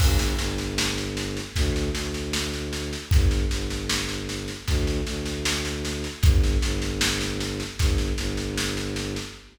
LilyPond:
<<
  \new Staff \with { instrumentName = "Violin" } { \clef bass \time 4/4 \key g \minor \tempo 4 = 77 g,,8 g,,4. d,8 d,4. | g,,8 g,,4. d,8 d,4. | g,,8 g,,4. g,,8 g,,4. | }
  \new DrumStaff \with { instrumentName = "Drums" } \drummode { \time 4/4 <cymc bd sn>16 sn16 sn16 sn16 sn16 sn16 sn16 sn16 <bd sn>16 sn16 sn16 sn16 sn16 sn16 sn16 sn16 | <bd sn>16 sn16 sn16 sn16 sn16 sn16 sn16 sn16 <bd sn>16 sn16 sn16 sn16 sn16 sn16 sn16 sn16 | <bd sn>16 sn16 sn16 sn16 sn16 sn16 sn16 sn16 <bd sn>16 sn16 sn16 sn16 sn16 sn16 sn16 sn16 | }
>>